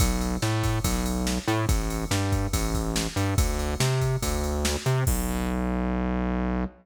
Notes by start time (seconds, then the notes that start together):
0.00 B1, kick, ride
0.21 ride
0.42 A2, snare
0.63 kick, ride
0.84 B1, kick, ride
1.06 ride
1.27 snare
1.48 A2, ride
1.69 A1, kick, ride
1.90 ride
2.11 G2, snare
2.32 kick, ride
2.53 A1, kick, ride
2.75 kick, ride
2.96 snare
3.16 G2, ride
3.38 D2, kick, ride
3.59 ride
3.80 C3, snare
4.01 kick, ride
4.22 D2, kick, ride
4.44 ride
4.65 snare
4.86 C3, ride
5.07 B1, kick, crash